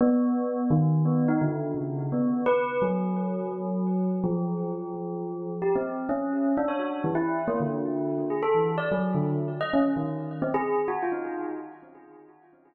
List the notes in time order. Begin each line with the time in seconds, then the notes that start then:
0.01 B3
0.70 D#3
1.05 B3
1.28 D#4
1.42 D3
1.75 C#3
2.12 B3
2.46 B4
2.82 F#3
4.24 F3
5.62 G4
5.76 C4
6.09 C#4
6.57 D4
6.68 C#5
6.79 F#4
7.04 E3
7.15 E4
7.48 A#3
7.60 D3
8.30 G#4
8.43 A4
8.54 E3
8.78 D5
8.92 F#3
9.14 D3
9.61 D#5
9.74 C#4
9.96 D#3
10.42 C4
10.54 G#4
10.88 F#4
11.03 F4
11.12 D#4